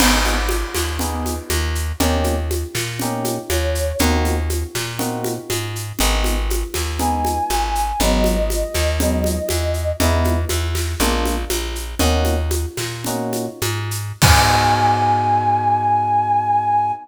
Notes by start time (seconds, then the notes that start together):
0.00 G#1 B3 D#4 G#4, crash, low conga, shaker
0.25 high conga, shaker
0.49 high conga, shaker
0.74 D#2, snare, high conga, shaker
0.99 B3 D#4 G#4, low conga, shaker
1.26 high conga, shaker
1.50 D#2, high conga, shaker
1.75 shaker
2.00 D#2 A#3 C#4 D#4 G4, low conga, shaker
2.24 high conga, shaker
2.51 high conga, shaker
2.75 A#2, snare, high conga, shaker
2.99 A#3 C#4 D#4 G4, low conga, shaker
3.24 high conga, shaker
3.49 D#2 C#5, high conga, shaker
3.75 shaker
3.99 D#2 A#3 C4 D#4 F#4, low conga, shaker
4.25 high conga, shaker
4.50 high conga, shaker
4.75 A#2, snare, high conga, shaker
4.99 A#3 C4 D#4 F#4, low conga, shaker
5.24 high conga, shaker
5.50 G#2, high conga, shaker
5.76 shaker
5.99 G#1 G#3 B3 D#4, low conga, shaker
6.24 high conga, shaker
6.50 high conga, shaker
6.74 D#2, snare, high conga, shaker
6.99 G#3 B3 D#4 G#5, low conga, shaker
7.25 high conga, shaker
7.50 G#1, high conga, shaker
7.75 shaker
8.00 G#1 F#3 G#3 B3 D#4 D#5, low conga, shaker
8.24 high conga, shaker
8.50 high conga, shaker
8.74 D#2, snare, high conga, shaker
9.00 F#3 G#3 B3 D#4, low conga, shaker
9.24 high conga, shaker
9.49 E2, high conga, shaker
9.74 shaker
10.00 E2 G#3 B3 D#4 E4, low conga, shaker
10.24 high conga, shaker
10.49 E2, high conga, shaker
10.75 snare, high conga, shaker
10.99 A#1 G#3 A#3 D4 F4, low conga, shaker
11.26 high conga, shaker
11.50 A#1, high conga, shaker
11.75 shaker
11.99 D#2 A#3 C#4 D#4 F#4, low conga, shaker
12.25 high conga, shaker
12.51 high conga, shaker
12.77 A#2, snare, high conga, shaker
13.04 A#3 C#4 D#4 F#4, low conga, shaker
13.33 high conga, shaker
13.62 G#2, high conga, shaker
13.91 shaker
14.22 G#2 B3 D#4 F#4 G#4 G#5, kick, crash